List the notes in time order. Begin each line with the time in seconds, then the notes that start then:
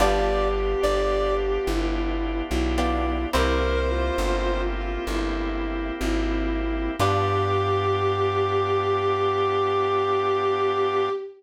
0.00 G1 B3 D4 F4 G4 D5
0.54 G4
0.83 G1 D5
1.67 G1 E4
2.49 B1 E4
2.78 B3 D4 F4 G4
3.33 C2 A#3 C4 E4 G4 A#4 C5
3.90 F4
4.18 G1
4.76 F4
5.07 G1 E4
6.01 G#1 E4
7.00 G2 B3 D4 F4 G4